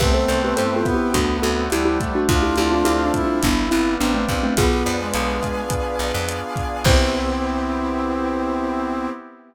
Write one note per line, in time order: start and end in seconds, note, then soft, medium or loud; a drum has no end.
0.00 0.26 C2 loud
0.00 0.82 A3 medium
0.00 1.09 B3 loud
0.00 0.82 C4 loud
0.00 0.14 G4 medium
0.00 0.14 B4 medium
0.00 1.14 B4 loud
0.00 1.14 C5 loud
0.00 1.14 E5 loud
0.00 1.14 G5 medium
0.00 kick medium
0.00 cross-stick medium
0.00 crash medium
0.14 0.28 A4 medium
0.14 0.28 C5 medium
0.28 0.54 C2 medium
0.28 1.10 C4 medium
0.28 0.42 A4 medium
0.28 0.42 C5 medium
0.28 closed hi-hat medium
0.44 0.58 G4 medium
0.44 0.58 B4 medium
0.57 0.84 G2 medium
0.57 1.11 E4 medium
0.57 0.75 A4 medium
0.57 0.75 C5 medium
0.57 closed hi-hat medium
0.76 0.94 F4 medium
0.76 0.94 A4 medium
0.85 1.65 B3 loud
0.85 1.13 G4 medium
0.85 kick medium
0.85 cross-stick medium
0.85 closed hi-hat medium
0.94 1.13 E4 medium
0.94 1.13 G4 medium
1.14 1.40 D2 loud
1.14 2.00 A3 loud
1.14 1.37 D4 medium
1.14 1.37 F#4 medium
1.14 2.28 A4 medium
1.14 2.28 C5 loud
1.14 2.28 D5 medium
1.14 2.28 F#5 loud
1.14 kick medium
1.14 closed hi-hat medium
1.42 1.69 D2 medium
1.42 2.24 C4 medium
1.42 1.68 F#4 medium
1.42 1.68 A4 medium
1.42 closed hi-hat medium
1.70 1.98 D2 medium
1.70 2.19 G3 medium
1.70 2.26 D4 medium
1.70 1.85 E4 medium
1.70 1.85 G4 medium
1.70 cross-stick medium
1.70 closed hi-hat medium
1.85 1.99 E4 medium
1.85 1.99 G4 medium
2.00 3.37 A3 loud
2.00 kick medium
2.00 closed hi-hat medium
2.15 2.28 D4 medium
2.15 2.29 F#4 medium
2.28 2.55 D2 loud
2.28 2.42 D4 medium
2.28 3.12 D4 loud
2.28 2.42 F4 medium
2.28 3.12 F4 loud
2.28 3.41 A4 medium
2.28 3.41 C5 medium
2.28 3.41 D5 medium
2.28 3.41 F5 medium
2.28 kick medium
2.28 closed hi-hat medium
2.42 2.56 E4 medium
2.42 2.56 G4 medium
2.56 2.83 D2 medium
2.56 3.38 C4 medium
2.56 2.71 E4 medium
2.56 2.71 G4 medium
2.56 closed hi-hat medium
2.72 2.86 D4 medium
2.72 2.86 F4 medium
2.85 3.11 D2 medium
2.85 3.40 D4 medium
2.85 3.03 E4 medium
2.85 3.03 G4 medium
2.85 cross-stick medium
2.85 closed hi-hat medium
3.05 3.23 D4 medium
3.05 3.23 F4 medium
3.14 4.51 G3 loud
3.14 3.94 E4 loud
3.14 kick medium
3.14 closed hi-hat medium
3.24 3.42 D4 medium
3.24 3.42 F4 medium
3.43 3.69 G1 loud
3.43 3.67 B3 medium
3.43 3.67 D4 medium
3.43 4.56 G4 medium
3.43 4.56 B4 medium
3.43 4.56 D5 medium
3.43 4.56 F5 medium
3.43 kick medium
3.43 closed hi-hat medium
3.71 3.98 G1 medium
3.71 4.53 B3 loud
3.71 3.95 C4 medium
3.71 3.95 E4 medium
3.71 cross-stick medium
3.71 closed hi-hat medium
4.00 4.26 A1 medium
4.00 4.14 B3 medium
4.00 4.46 C4 medium
4.00 4.54 D4 medium
4.00 4.14 D4 medium
4.00 closed hi-hat medium
4.14 4.28 A3 medium
4.14 4.28 C4 medium
4.28 4.55 A#1 medium
4.28 4.56 F4 medium
4.28 kick medium
4.28 closed hi-hat medium
4.43 4.57 A3 medium
4.43 4.57 C4 medium
4.57 4.83 B1 loud
4.57 4.97 B3 loud
4.57 6.84 B3 loud
4.57 6.84 D4 loud
4.57 6.84 F4 medium
4.57 6.75 F4 medium
4.57 6.84 G#4 loud
4.57 6.75 G#4 medium
4.57 5.71 B4 loud
4.57 kick medium
4.57 cross-stick medium
4.57 closed hi-hat loud
4.86 5.12 F2 medium
4.86 5.99 D5 medium
4.86 closed hi-hat medium
5.00 5.61 G#3 medium
5.14 5.40 B1 medium
5.14 6.28 F5 loud
5.14 closed hi-hat medium
5.43 6.57 G#5 medium
5.43 kick medium
5.43 cross-stick medium
5.43 closed hi-hat medium
5.70 6.80 B4 medium
5.70 kick medium
5.70 closed hi-hat medium
5.99 6.12 B1 medium
5.99 6.81 D5 loud
5.99 closed hi-hat medium
6.14 6.40 F2 loud
6.28 6.83 F5 medium
6.28 cross-stick medium
6.28 closed hi-hat medium
6.56 6.84 G#5 medium
6.56 kick medium
6.56 closed hi-hat medium
6.84 9.08 C2 loud
6.84 9.08 B3 loud
6.84 9.09 B3 loud
6.84 9.08 C4 loud
6.84 9.09 C4 loud
6.84 9.08 E4 loud
6.84 9.09 E4 loud
6.84 9.08 G4 loud
6.84 9.09 G4 loud
6.84 9.09 C5 loud
6.84 kick loud
6.84 crash loud